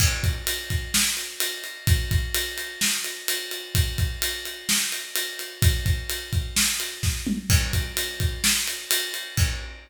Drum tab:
CC |x-------|--------|--------|--------|
RD |-xxx-xxx|xxxx-xxx|xxxx-xxx|xxxx-x--|
SD |----o---|----o---|----o---|----o-o-|
T2 |--------|--------|--------|-------o|
BD |oo-o----|oo------|oo------|oo-o--o-|

CC |x-------|x-------|
RD |-xxx-xxx|--------|
SD |----o---|--------|
T2 |--------|--------|
BD |oo-o----|o-------|